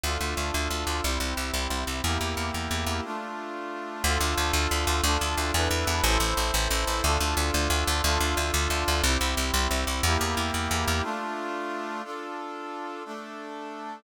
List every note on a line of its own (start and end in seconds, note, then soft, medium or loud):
0.04 0.18 D2 medium
0.04 1.03 D4 medium
0.04 1.03 F4 loud
0.04 1.03 A4 medium
0.21 0.35 D2 medium
0.37 0.51 D2 medium
0.54 0.68 D2 medium
0.70 0.85 D2 medium
0.87 1.01 D2 medium
1.03 1.18 C2 medium
1.03 2.02 C4 medium
1.03 2.02 E4 medium
1.03 2.02 G4 medium
1.20 1.34 C2 medium
1.37 1.51 C2 medium
1.54 1.68 C2 medium
1.70 1.85 C2 medium
1.87 2.01 C2 medium
2.04 2.18 E2 medium
2.04 3.04 A#3 medium
2.04 3.04 E4 medium
2.04 3.04 G4 medium
2.21 2.35 E2 medium
2.37 2.51 E2 medium
2.54 2.68 E2 medium
2.71 2.85 E2 medium
2.86 3.01 E2 medium
3.04 4.03 A3 medium
3.04 4.03 D4 medium
3.04 4.03 F4 medium
4.04 4.18 D2 loud
4.04 5.03 D4 medium
4.04 5.03 F4 loud
4.04 5.03 A4 loud
4.21 4.35 D2 loud
4.37 4.52 D2 medium
4.53 4.68 D2 loud
4.71 4.85 D2 medium
4.87 5.01 D2 loud
5.03 5.18 D2 loud
5.03 5.53 D4 loud
5.03 5.53 F4 loud
5.03 5.53 A4 medium
5.21 5.35 D2 medium
5.37 5.52 D2 medium
5.54 5.68 E2 loud
5.54 6.04 D4 loud
5.54 6.04 E4 loud
5.54 6.04 A4 loud
5.54 6.04 B4 loud
5.71 5.85 E2 medium
5.87 6.01 E2 loud
6.04 6.18 A1 loud
6.04 7.03 E4 loud
6.04 7.03 A4 loud
6.04 7.03 C5 loud
6.20 6.34 A1 medium
6.37 6.51 A1 medium
6.54 6.68 A1 loud
6.71 6.85 A1 loud
6.87 7.01 A1 medium
7.03 7.18 D2 loud
7.03 8.02 D4 loud
7.03 8.02 F4 loud
7.03 8.02 A4 loud
7.20 7.35 D2 medium
7.37 7.51 D2 loud
7.54 7.68 D2 loud
7.70 7.84 D2 loud
7.87 8.02 D2 loud
8.04 8.18 D2 loud
8.04 9.03 D4 loud
8.04 9.03 F4 loud
8.04 9.03 A4 loud
8.20 8.35 D2 medium
8.37 8.51 D2 medium
8.54 8.68 D2 loud
8.70 8.84 D2 medium
8.88 9.02 D2 loud
9.04 9.18 C2 loud
9.04 10.04 C4 medium
9.04 10.04 E4 loud
9.04 10.04 G4 medium
9.21 9.35 C2 medium
9.37 9.51 C2 medium
9.54 9.68 C2 loud
9.71 9.85 C2 medium
9.87 10.01 C2 medium
10.03 10.17 E2 loud
10.03 11.03 A#3 loud
10.03 11.03 E4 loud
10.03 11.03 G4 loud
10.21 10.35 E2 medium
10.37 10.51 E2 medium
10.54 10.68 E2 medium
10.71 10.85 E2 medium
10.88 11.02 E2 medium
11.03 12.02 A3 loud
11.03 12.02 D4 loud
11.03 12.02 F4 loud
12.04 13.03 D4 medium
12.04 13.03 F4 medium
12.04 13.03 A4 medium
13.05 14.03 A3 medium
13.05 14.03 D4 medium
13.05 14.03 A4 medium